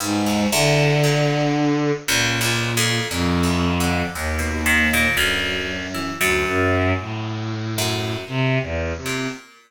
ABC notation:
X:1
M:3/4
L:1/16
Q:1/4=58
K:none
V:1 name="Violin" clef=bass
^G,,2 D,6 ^A,,4 | F,,4 ^D,,4 ^F,,4 | D,, ^F,,2 A,,5 (3C,2 E,,2 C,2 |]
V:2 name="Orchestral Harp" clef=bass
G,, ^D,, E,,2 ^A,,3 z (3^C,,2 C,,2 F,,2 | (3^A,,2 E,,2 D,2 ^D,, B,, ^D, A,, =D,,3 E, | ^F,,6 F,,2 z3 ^A,, |]